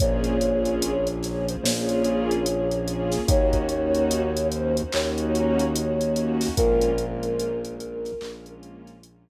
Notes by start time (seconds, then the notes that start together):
0.00 A#1 A#3 C#4 F4 G#4 C#5, kick, closed hi-hat
0.24 closed hi-hat
0.41 A#3 C#4 F4 G#4, closed hi-hat
0.65 closed hi-hat
0.82 closed hi-hat
1.07 A#3 C#4 F4 G#4, closed hi-hat
1.23 A#3 C#4 F4 G#4 C#5, snare, closed hi-hat
1.48 A#3 C#4 F4 G#4 C5, closed hi-hat
1.63 A#1 A#3 C#4 F4 G#4 C#5, snare
1.89 closed hi-hat
2.04 closed hi-hat
2.31 closed hi-hat
2.46 A#3 C#4 F4 G#4, closed hi-hat
2.71 A#3 C#4 F4 G#4, closed hi-hat
2.88 closed hi-hat
3.12 snare, closed hi-hat
3.28 D#2 A#3 C#4 D#4 F#4 C#5, kick, closed hi-hat
3.53 kick, closed hi-hat
3.69 A#3 C#4 D#4 F#4, closed hi-hat
3.95 closed hi-hat
4.11 closed hi-hat
4.36 A#3 C#4 D#4 F#4, closed hi-hat
4.52 A#3 C#4 D#4 F#4 C5, closed hi-hat
4.77 A#3 C#4 D#4 F#4 C5, closed hi-hat
4.92 D#2 A#3 C#4 D#4 F#4 C#5, clap
5.18 closed hi-hat
5.35 closed hi-hat
5.59 closed hi-hat
5.75 A#3 C#4 D#4 F#4, closed hi-hat
6.00 A#3 C#4 D#4 F#4, closed hi-hat
6.16 closed hi-hat
6.41 snare, open hi-hat
6.57 A#1 G#3 A#3 C#4 F4 A#4, kick, closed hi-hat
6.81 closed hi-hat
6.98 G#3 A#3 C#4 F4, closed hi-hat
7.23 closed hi-hat
7.40 closed hi-hat
7.64 G#3 A#3 C#4 F4, closed hi-hat
7.80 G#3 A#3 C#4 F4, closed hi-hat
8.05 G#3 A#3 C#4 F4, snare, closed hi-hat
8.21 A#1 G#3 A#3 C#4 F4, clap
8.46 closed hi-hat
8.63 closed hi-hat
8.87 snare, closed hi-hat
9.03 G#3 A#3 C#4 F4, closed hi-hat